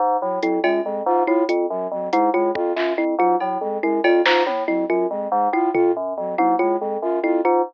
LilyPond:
<<
  \new Staff \with { instrumentName = "Electric Piano 2" } { \clef bass \time 9/8 \tempo 4. = 94 aes,8 a,8 f,8 ges,8 f,8 aes,8 a,8 f,8 ges,8 | f,8 aes,8 a,8 f,8 ges,8 f,8 aes,8 a,8 f,8 | ges,8 f,8 aes,8 a,8 f,8 ges,8 f,8 aes,8 a,8 | f,8 ges,8 f,8 aes,8 a,8 f,8 ges,8 f,8 aes,8 | }
  \new Staff \with { instrumentName = "Flute" } { \time 9/8 r8 ges8 ges8 aes8 aes8 f'8 f'8 r8 ges8 | ges8 aes8 aes8 f'8 f'8 r8 ges8 ges8 aes8 | aes8 f'8 f'8 r8 ges8 ges8 aes8 aes8 f'8 | f'8 r8 ges8 ges8 aes8 aes8 f'8 f'8 r8 | }
  \new Staff \with { instrumentName = "Kalimba" } { \time 9/8 r4 e'8 f'8 r4 e'8 f'8 r8 | r8 e'8 f'8 r4 e'8 f'8 r4 | e'8 f'8 r4 e'8 f'8 r4 e'8 | f'8 r4 e'8 f'8 r4 e'8 f'8 | }
  \new DrumStaff \with { instrumentName = "Drums" } \drummode { \time 9/8 r4 hh8 cb4. r8 hh4 | r8 hh4 bd8 hc4 r8 cb4 | r8 cb8 sn8 tommh4. r4. | tomfh4. tommh4. r4. | }
>>